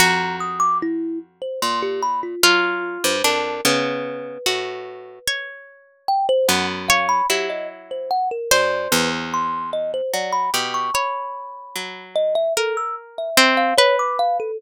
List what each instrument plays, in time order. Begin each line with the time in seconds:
0.00 orchestral harp F2, pizzicato strings F#4, kalimba A#5
0.40 kalimba D#6
0.60 kalimba D6
0.82 kalimba E4
1.42 kalimba C5
1.62 orchestral harp A#2, kalimba C6
1.82 kalimba G4
2.03 kalimba B5
2.23 kalimba F4
2.43 orchestral harp F#3, kalimba F4, pizzicato strings F4
3.04 orchestral harp G2, kalimba C5
3.24 orchestral harp F2, pizzicato strings D4, kalimba A#4
3.65 orchestral harp C#3, pizzicato strings B3, kalimba B4
4.46 orchestral harp A2, pizzicato strings F#4
5.28 pizzicato strings C#5
6.08 kalimba G5
6.29 kalimba C5
6.48 orchestral harp F#2, pizzicato strings B3, kalimba F#5
6.89 pizzicato strings C#5, kalimba F5
7.09 kalimba B5
7.30 orchestral harp F#3, pizzicato strings E4, kalimba G4
7.50 kalimba D#5
7.91 kalimba C5
8.11 kalimba F#5
8.31 kalimba A#4
8.51 orchestral harp F#2, pizzicato strings C5, kalimba D5
8.92 orchestral harp E2, kalimba B4
9.34 kalimba C6
9.73 kalimba D#5
9.94 kalimba C5
10.14 orchestral harp F#3, kalimba D5
10.33 kalimba B5
10.54 orchestral harp B2, pizzicato strings G4
10.74 kalimba C#6
10.94 pizzicato strings C#5, kalimba B5
11.76 orchestral harp F#3
12.16 kalimba D#5
12.35 kalimba E5
12.57 kalimba A4, pizzicato strings A#4
12.77 kalimba E6
13.18 kalimba E5
13.37 pizzicato strings C4
13.57 kalimba F5
13.78 pizzicato strings B4, kalimba C#5
13.99 kalimba D6
14.19 kalimba F5
14.40 kalimba A4